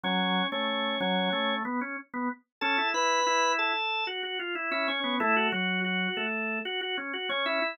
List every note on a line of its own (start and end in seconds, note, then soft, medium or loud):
0.03 0.43 F#3 loud
0.03 0.47 C#4 medium
0.03 0.47 C#5 medium
0.52 0.95 A3 loud
0.52 0.99 C#4 medium
0.52 0.99 C#5 medium
1.00 1.29 F#3 loud
1.00 1.54 C#4 medium
1.00 1.54 C#5 medium
1.33 1.63 A3 loud
1.65 1.80 B3 loud
1.81 1.97 C#4 medium
2.14 2.29 B3 loud
2.61 2.77 C#4 loud
2.61 2.88 A4 medium
2.61 2.88 A5 medium
2.78 2.93 E4 loud
2.94 3.20 E4 loud
2.94 3.52 B4 medium
2.94 3.52 B5 medium
3.26 3.72 E4 loud
3.59 4.04 A4 medium
3.59 4.04 A5 medium
4.07 4.22 F#4 loud
4.23 4.38 F#4 loud
4.39 4.55 F4 medium
4.55 4.70 E4 loud
4.71 5.00 C#4 loud
4.71 4.87 E4 medium
4.71 4.87 E5 medium
4.88 5.15 C#4 medium
4.88 5.15 C#5 medium
5.04 5.19 B3 medium
5.20 5.47 A3 medium
5.20 5.35 E4 loud
5.20 5.47 A4 loud
5.36 5.52 F#4 loud
5.52 6.07 F#3 medium
5.52 5.80 F#4 loud
5.52 6.07 F#4 medium
5.84 6.25 F#4 medium
6.17 6.59 A3 medium
6.17 6.59 A4 medium
6.65 6.81 F#4 loud
6.81 6.97 F#4 loud
6.98 7.13 C#4 loud
7.13 7.29 F#4 loud
7.29 7.60 C#4 loud
7.29 7.45 C#4 medium
7.29 7.45 C#5 medium
7.46 7.76 E4 medium
7.46 7.76 E5 medium
7.62 7.77 E4 loud